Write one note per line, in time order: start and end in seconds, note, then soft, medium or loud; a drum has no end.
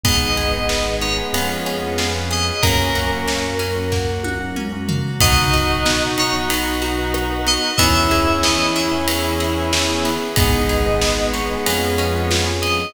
0.03 1.22 G#1 loud
0.03 2.12 G#3 medium
0.03 0.30 B3 medium
0.03 0.69 B3 medium
0.03 2.12 B3 medium
0.03 0.30 D#4 medium
0.03 0.69 D#4 medium
0.03 0.30 G#4 medium
0.03 0.69 G#4 medium
0.03 0.95 D#5 loud
0.03 kick loud
0.03 ride loud
0.37 0.50 B3 medium
0.37 0.50 D#4 medium
0.37 0.50 G#4 medium
0.37 1.29 G#4 medium
0.37 ride medium
0.53 0.66 B3 medium
0.53 0.66 D#4 medium
0.53 0.66 G#4 medium
0.69 1.33 G#3 medium
0.69 1.31 B3 medium
0.69 1.08 B3 medium
0.69 1.33 B3 medium
0.69 1.08 D#4 medium
0.69 1.08 G#4 medium
0.69 1.33 G#4 medium
0.69 snare loud
1.01 1.32 D#4 medium
1.01 1.17 C#5 medium
1.01 ride medium
1.18 1.31 B3 medium
1.18 1.31 D#4 medium
1.18 1.31 G#4 medium
1.33 2.51 F2 loud
1.33 1.72 B3 medium
1.33 1.98 B3 loud
1.33 2.57 B3 medium
1.33 1.72 C#4 medium
1.33 1.98 C#4 medium
1.33 1.72 F4 medium
1.33 1.98 F4 medium
1.33 1.72 G#4 medium
1.33 1.98 G#4 medium
1.33 ride medium
1.66 2.58 C#4 medium
1.66 ride medium
1.82 2.08 B3 medium
1.82 2.08 C#4 medium
1.82 2.08 F4 medium
1.82 2.08 G#4 medium
1.98 2.62 B3 medium
1.98 2.62 C#4 medium
1.98 2.60 F4 medium
1.98 2.62 G#4 medium
1.98 2.62 B4 medium
1.98 snare loud
2.15 2.53 B3 medium
2.15 2.53 C#4 medium
2.15 2.53 F4 medium
2.15 2.53 G#4 medium
2.31 2.61 G#4 medium
2.31 2.63 D#5 medium
2.31 ride medium
2.62 5.01 F#2 loud
2.62 3.46 A#3 medium
2.62 3.91 A#3 medium
2.62 2.89 A#3 medium
2.62 3.27 A#3 medium
2.62 3.46 C#4 medium
2.62 3.91 C#4 medium
2.62 2.89 C#4 medium
2.62 3.91 F#4 medium
2.62 2.89 F#4 medium
2.62 4.14 A#4 medium
2.62 kick medium
2.62 ride loud
2.95 3.08 A#3 medium
2.95 3.08 C#4 medium
2.95 3.08 F#4 medium
2.95 4.24 F#4 medium
2.95 ride medium
3.11 3.24 A#3 medium
3.11 3.24 C#4 medium
3.11 3.24 F#4 medium
3.27 3.66 A#3 medium
3.27 3.91 A#3 medium
3.27 3.66 C#4 medium
3.27 3.66 F#4 medium
3.27 snare medium
3.59 4.56 C#4 medium
3.59 ride medium
3.76 4.27 A#3 medium
3.76 4.27 C#4 medium
3.76 4.27 F#4 medium
3.92 5.20 F#3 medium
3.92 4.88 A#3 medium
3.92 5.20 A#3 medium
3.92 5.20 F#4 medium
3.92 kick medium
3.92 snare medium
4.24 5.16 F#4 medium
4.24 high tom medium
4.40 4.66 A#3 medium
4.40 4.66 C#4 medium
4.40 4.66 F#4 medium
4.56 5.17 C#4 medium
4.56 mid tom medium
4.72 5.11 A#3 medium
4.72 5.11 C#4 medium
4.72 5.11 F#4 medium
4.89 5.19 A#3 medium
4.89 floor tom loud
5.20 7.58 B1 loud
5.20 5.47 B3 medium
5.20 5.53 B3 medium
5.20 6.49 B3 medium
5.20 7.70 D#4 medium
5.20 5.47 D#4 loud
5.20 6.49 D#4 medium
5.20 7.70 F#4 medium
5.20 5.47 F#4 medium
5.20 6.49 F#4 medium
5.20 6.03 D#5 loud
5.20 kick loud
5.20 ride loud
5.53 5.66 B3 medium
5.53 5.66 D#4 medium
5.53 5.66 F#4 medium
5.53 5.86 F#4 medium
5.53 ride medium
5.69 5.82 B3 medium
5.69 5.82 D#4 medium
5.69 5.82 F#4 medium
5.85 6.24 B3 medium
5.85 6.18 B3 medium
5.85 6.24 D#4 medium
5.85 6.24 F#4 medium
5.85 snare loud
6.18 6.50 D#4 medium
6.18 6.34 C#5 medium
6.18 ride medium
6.34 6.85 B3 medium
6.34 6.85 D#4 medium
6.34 6.85 F#4 medium
6.50 6.82 B3 medium
6.50 7.78 B3 medium
6.50 7.78 F#4 loud
6.50 7.78 B4 medium
6.50 ride loud
6.82 7.15 F#4 medium
6.82 ride medium
6.98 7.24 B3 medium
6.98 7.24 D#4 medium
6.98 7.24 F#4 medium
7.14 7.47 D#4 medium
7.14 cross-stick loud
7.30 7.69 B3 medium
7.30 7.69 D#4 medium
7.30 7.69 F#4 medium
7.47 7.77 B3 medium
7.47 7.79 D#5 medium
7.47 ride medium
7.77 10.18 E2 loud
7.77 8.11 B3 medium
7.77 9.07 B3 medium
7.77 8.05 B3 medium
7.77 10.11 C#4 medium
7.77 10.11 E4 medium
7.77 9.07 E4 medium
7.77 8.05 E4 medium
7.77 9.07 G#4 medium
7.77 8.05 G#4 medium
7.77 8.40 E5 loud
7.77 kick medium
7.77 ride loud
8.11 8.24 B3 medium
8.11 8.24 E4 medium
8.11 8.24 G#4 medium
8.11 8.44 G#4 medium
8.11 ride medium
8.27 8.40 B3 medium
8.27 8.40 E4 medium
8.27 8.40 G#4 medium
8.43 8.76 B3 medium
8.43 8.82 B3 medium
8.43 8.82 E4 medium
8.43 8.82 G#4 medium
8.43 8.73 D#5 medium
8.43 snare loud
8.75 9.08 E4 medium
8.75 8.91 E5 medium
8.75 ride medium
8.92 9.43 B3 medium
8.92 9.43 E4 medium
8.92 9.43 G#4 medium
9.08 9.40 B3 medium
9.08 10.36 B3 loud
9.08 10.36 G#4 loud
9.08 10.36 B4 medium
9.08 ride loud
9.40 9.72 G#4 medium
9.40 ride medium
9.57 9.83 B3 medium
9.57 9.83 E4 medium
9.57 9.83 G#4 medium
9.73 10.05 E4 medium
9.73 snare loud
9.89 10.27 B3 medium
9.89 10.27 E4 medium
9.89 10.27 G#4 medium
10.05 10.36 B3 medium
10.05 ride medium
10.36 11.57 G#1 loud
10.36 12.44 G#3 medium
10.36 10.69 B3 medium
10.36 12.44 B3 medium
10.36 10.63 B3 loud
10.36 11.01 B3 loud
10.36 10.63 D#4 medium
10.36 11.01 D#4 medium
10.36 10.63 G#4 medium
10.36 11.01 G#4 loud
10.36 11.26 D#5 loud
10.36 kick loud
10.36 ride loud
10.69 10.82 B3 medium
10.69 10.82 D#4 medium
10.69 10.82 G#4 medium
10.69 11.02 G#4 medium
10.69 ride medium
10.86 10.99 B3 medium
10.86 10.99 D#4 medium
10.86 10.99 G#4 medium
11.01 11.65 G#3 medium
11.01 11.40 B3 medium
11.01 11.65 B3 loud
11.01 11.34 B3 medium
11.01 11.40 D#4 medium
11.01 11.40 G#4 medium
11.01 11.65 G#4 medium
11.01 snare loud
11.33 11.65 D#4 medium
11.33 11.48 C#5 loud
11.33 ride medium
11.50 11.63 B3 medium
11.50 11.63 D#4 medium
11.50 11.63 G#4 medium
11.66 12.85 F2 loud
11.66 12.30 B3 loud
11.66 11.99 B3 medium
11.66 12.05 B3 medium
11.66 12.30 C#4 loud
11.66 12.05 C#4 medium
11.66 12.30 F4 medium
11.66 12.05 F4 medium
11.66 12.30 G#4 loud
11.66 12.05 G#4 loud
11.66 ride loud
11.98 12.31 C#4 medium
11.98 ride medium
12.14 12.40 B3 medium
12.14 12.40 C#4 medium
12.14 12.40 F4 medium
12.14 12.40 G#4 medium
12.31 12.93 B3 medium
12.31 12.93 C#4 medium
12.31 12.63 F4 medium
12.31 12.93 G#4 loud
12.31 12.93 B4 medium
12.31 snare loud
12.47 12.85 B3 medium
12.47 12.85 C#4 medium
12.47 12.85 F4 medium
12.47 12.85 G#4 medium
12.62 12.93 G#4 medium
12.62 12.93 D#5 loud
12.62 ride medium